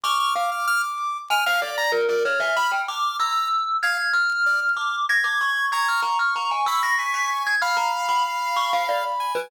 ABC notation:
X:1
M:6/8
L:1/16
Q:3/8=63
K:none
V:1 name="Glockenspiel"
^c'2 f z5 ^g f d2 | ^A A ^c e b g d'2 e'4 | ^g'2 f'4 d'2 ^a' d' ^c'2 | ^g' f' ^a f' a ^g e' ^a' b' b' z g' |
f' ^a z b z2 ^c' f d z2 B |]
V:2 name="Ocarina"
d'8 z4 | z2 f'4 z6 | f'8 ^g'4 | ^c'12 |
b12 |]
V:3 name="Lead 2 (sawtooth)"
f' f' f' f' f' z3 f' f' d' ^a | z d z ^g b z f'2 ^a2 z2 | f z3 d z7 | ^a2 z4 b2 ^g4 |
f10 ^g2 |]